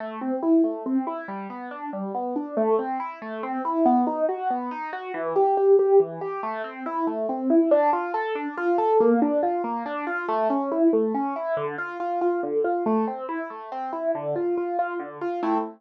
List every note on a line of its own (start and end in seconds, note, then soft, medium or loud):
0.00 0.20 A3 medium
0.21 0.41 C4 medium
0.43 0.62 E4 medium
0.64 0.83 A3 medium
0.86 1.05 C4 medium
1.07 1.26 E4 medium
1.28 1.47 G3 medium
1.50 1.69 B3 medium
1.71 1.90 D4 medium
1.93 2.12 G3 medium
2.15 2.34 B3 medium
2.36 2.55 D4 medium
2.57 2.76 A3 medium
2.79 2.98 C4 medium
3.00 3.19 E4 medium
3.22 3.41 A3 medium
3.43 3.62 C4 medium
3.65 3.84 E4 medium
3.86 4.05 B3 loud
4.07 4.26 D#4 medium
4.29 4.48 F#4 medium
4.50 4.70 B3 medium
4.71 4.91 D#4 medium
4.93 5.12 F#4 medium
5.14 5.33 E3 loud
5.36 5.55 G4 medium
5.57 5.77 G4 medium
5.79 5.98 G4 medium
6.00 6.19 E3 medium
6.21 6.41 G4 medium
6.43 6.62 A3 medium
6.64 6.83 C4 medium
6.86 7.05 E4 medium
7.07 7.27 A3 medium
7.29 7.48 C4 medium
7.50 7.69 E4 medium
7.71 7.91 D4 loud
7.93 8.12 F4 medium
8.14 8.33 A4 medium
8.35 8.55 D4 medium
8.57 8.77 F4 medium
8.78 8.97 A4 medium
9.00 9.20 A#3 loud
9.22 9.41 D4 medium
9.43 9.62 F4 medium
9.64 9.83 A#3 medium
9.86 10.05 D4 medium
10.07 10.26 F4 medium
10.28 10.48 A3 loud
10.50 10.69 C#4 medium
10.72 10.91 E4 medium
10.93 11.12 A3 medium
11.14 11.34 C#4 medium
11.36 11.55 E4 medium
11.57 11.76 D3 loud
11.78 11.98 F4 medium
12.00 12.19 F4 medium
12.21 12.41 F4 medium
12.43 12.62 D3 medium
12.64 12.84 F4 medium
12.86 13.05 A3 loud
13.07 13.27 C4 medium
13.29 13.48 E4 medium
13.50 13.69 A3 medium
13.72 13.91 C4 medium
13.93 14.12 E4 medium
14.15 14.34 D3 loud
14.36 14.55 F4 medium
14.57 14.77 F4 medium
14.79 14.98 F4 medium
15.00 15.19 D3 medium
15.21 15.41 F4 medium
15.43 15.58 A3 medium
15.43 15.58 C4 medium
15.43 15.58 E4 medium